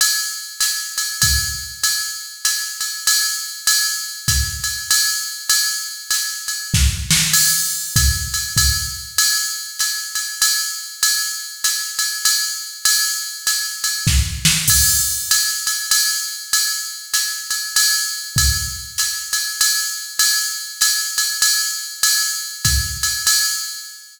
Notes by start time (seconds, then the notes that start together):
0.01 ride
0.60 hi-hat pedal, ride
0.98 ride
1.22 kick, ride
1.83 ride
2.45 hi-hat pedal, ride
2.81 ride
3.07 ride
3.67 ride
4.28 kick, hi-hat pedal, ride
4.64 ride
4.91 ride
5.49 ride
6.11 hi-hat pedal, ride
6.48 ride
6.74 kick, snare
7.11 snare
7.33 crash, ride
7.96 kick, hi-hat pedal, ride
8.34 ride
8.57 kick, ride
9.18 ride
9.79 hi-hat pedal, ride
10.15 ride
10.42 ride
11.03 ride
11.64 hi-hat pedal, ride
11.99 ride
12.25 ride
12.85 ride
13.47 hi-hat pedal, ride
13.84 ride
14.07 kick, snare
14.45 snare
14.68 kick, crash, ride
15.31 hi-hat pedal, ride
15.67 ride
15.91 ride
16.53 ride
17.14 hi-hat pedal, ride
17.51 ride
17.76 ride
18.36 kick, ride
18.98 hi-hat pedal, ride
19.33 ride
19.61 ride
20.19 ride
20.81 hi-hat pedal, ride
21.18 ride
21.42 ride
22.03 ride
22.65 kick, hi-hat pedal, ride
23.03 ride
23.27 ride